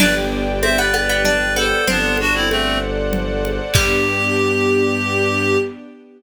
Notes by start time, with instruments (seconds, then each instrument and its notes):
0.00 violin G1, string ensemble 1 B3 D4 G4 B4 D5 G5, harpsichord D4, clarinet B4 D5, crash, low conga
0.62 string ensemble 1 B3 D4 G4, harpsichord C4, clarinet C5 E5, high conga
0.78 harpsichord B3, clarinet B4 D5
0.94 harpsichord B3, high conga
1.09 harpsichord B3
1.24 harpsichord D4, clarinet B4 D5, low conga
1.56 harpsichord B3, clarinet A4 C5, high conga
1.87 violin G1, clarinet B3 D4, harpsichord C4, string ensemble 1 A4 C5 D5 F#5, low conga
2.17 clarinet D4 F#4, high conga
2.34 clarinet C4 E4
2.49 clarinet A3 C4, high conga
3.13 low conga
3.45 high conga
3.74 violin G2, harpsichord G3, string ensemble 1 B3 D4 G4, clarinet G4, kick, crash